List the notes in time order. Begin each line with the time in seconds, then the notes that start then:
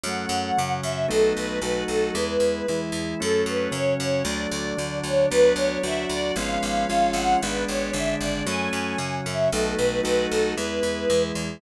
0.04 F#2 F#3 A3 C#4 F#5
0.29 F#2
0.57 F#2 C#3 F#3 C#4
0.83 F#2 E5
1.08 B1 F#3 A3 B3 D#4 A4
1.37 B1 B4
1.62 B1 F#3 A3 D#4 F#4 B4
1.88 B1 A4
2.14 E2 G#3 B3 E4 B4
2.40 E2
2.68 E2 E3 G#3 E4
2.92 E2
3.19 F#2 F#3 A3 C#4 A4
3.46 F#2 B4
3.71 F#2 C#3 F#3 C#4 C#5
3.98 F#2 C#5
4.24 D2 F#3 A3 D4 D5
4.51 D2
4.77 D2 D3 F#3 D4
5.04 D2 C#5
5.31 D2 F#3 B3 D4 B4
5.56 D2 C#5
5.83 D2 F#3 D4 F#4 E5
6.09 D2 D5
6.36 G#1 F3 G#3 B3 C#4 F5
6.63 G#1
6.89 G#1 F3 G#3 C#4 F4
7.13 G#1 F#5
7.42 G#1 G#3 B3 D4 B4
7.68 G#1 C#5
7.93 G#1 D3 G#3 D4 E5
8.20 G#1 D5
8.46 F#2 F#3 A3 C#4 G#5
8.73 F#2
8.98 F#2 C#3 F#3 C#4
9.26 F#2 E5
9.52 B1 F#3 A3 B3 D#4 A4
9.77 B1 B4
10.03 B1 F#3 A3 D#4 F#4 B4
10.30 B1 A4
10.57 E2 G#3 B3 E4 B4
10.83 E2
11.10 E2 E3 G#3 E4
11.35 E2